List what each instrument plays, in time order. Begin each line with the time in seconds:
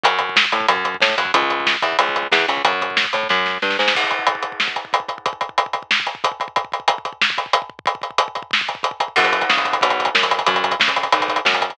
0.04 electric bass (finger) F#2, kick, closed hi-hat
0.19 kick, closed hi-hat
0.29 kick
0.36 kick, snare
0.45 kick
0.52 electric bass (finger) A2, kick, closed hi-hat
0.60 kick
0.68 electric bass (finger) F#2, kick, closed hi-hat
0.76 kick
0.84 kick, closed hi-hat
0.94 kick
1.00 electric bass (finger) A2, kick, snare
1.10 kick
1.18 electric bass (finger) F#2, kick, closed hi-hat
1.25 kick
1.34 electric bass (finger) C#2, kick, closed hi-hat
1.42 kick
1.50 kick, closed hi-hat
1.60 kick
1.66 kick, snare
1.74 kick
1.82 electric bass (finger) E2, kick, closed hi-hat
1.92 kick
1.99 electric bass (finger) C#2, kick, closed hi-hat
2.09 kick
2.16 kick, closed hi-hat
2.23 kick
2.32 electric bass (finger) E2, kick, snare
2.40 kick
2.48 electric bass (finger) C#2, kick, closed hi-hat
2.57 kick
2.65 electric bass (finger) F#2, kick, closed hi-hat
2.72 kick
2.81 kick, closed hi-hat
2.90 kick
2.97 kick, snare
3.04 kick
3.13 electric bass (finger) A2, kick, closed hi-hat
3.23 kick
3.29 electric bass (finger) F#2, kick, snare
3.46 snare
3.62 electric bass (finger) G2, snare
3.70 snare
3.79 electric bass (finger) G#2, snare
3.88 snare
3.95 kick, crash
4.04 kick
4.11 kick, closed hi-hat
4.19 kick
4.27 kick, closed hi-hat
4.35 kick
4.43 kick, closed hi-hat
4.52 kick
4.60 kick, snare
4.68 kick
4.76 kick, closed hi-hat
4.85 kick
4.93 kick, closed hi-hat
5.00 kick
5.08 kick, closed hi-hat
5.18 kick
5.26 kick, closed hi-hat
5.33 kick
5.41 kick, closed hi-hat
5.49 kick
5.58 kick, closed hi-hat
5.66 kick
5.73 kick, closed hi-hat
5.83 kick
5.91 kick, snare
6.00 kick
6.07 kick, closed hi-hat
6.15 kick
6.24 kick, closed hi-hat
6.32 kick
6.40 kick, closed hi-hat
6.48 kick
6.56 kick, closed hi-hat
6.65 kick
6.72 kick, closed hi-hat
6.80 kick
6.88 kick, closed hi-hat
6.98 kick
7.05 kick, closed hi-hat
7.13 kick
7.22 kick, snare
7.30 kick
7.38 kick, closed hi-hat
7.46 kick
7.53 kick, closed hi-hat
7.62 kick
7.70 kick
7.79 kick
7.86 kick, closed hi-hat
7.95 kick
8.02 kick, closed hi-hat
8.11 kick
8.18 kick, closed hi-hat
8.28 kick
8.35 kick, closed hi-hat
8.42 kick
8.51 kick, snare
8.61 kick
8.68 kick, closed hi-hat
8.75 kick
8.83 kick, closed hi-hat
8.91 kick
9.00 kick, closed hi-hat
9.08 kick
9.16 electric bass (finger) F#2, kick, crash
9.24 kick, closed hi-hat
9.33 kick, closed hi-hat
9.41 kick, closed hi-hat
9.50 electric bass (finger) C#3, kick, snare
9.57 kick, closed hi-hat
9.65 kick, closed hi-hat
9.73 kick, closed hi-hat
9.81 electric bass (finger) B1, kick, closed hi-hat
9.90 kick, closed hi-hat
10.00 kick, closed hi-hat
10.05 kick, closed hi-hat
10.15 electric bass (finger) F#2, kick, snare
10.23 kick, closed hi-hat
10.31 kick, closed hi-hat
10.39 kick, closed hi-hat
10.46 electric bass (finger) F#2, kick, closed hi-hat
10.54 kick, closed hi-hat
10.64 kick, closed hi-hat
10.71 kick, closed hi-hat
10.80 electric bass (finger) C#3, kick, snare
10.88 kick, closed hi-hat
10.96 kick, closed hi-hat
11.03 kick, closed hi-hat
11.12 electric bass (finger) B1, kick, closed hi-hat
11.20 kick, closed hi-hat
11.28 kick, closed hi-hat
11.36 kick, closed hi-hat
11.45 electric bass (finger) F#2, kick, snare
11.53 kick, closed hi-hat
11.61 kick, closed hi-hat
11.70 kick, closed hi-hat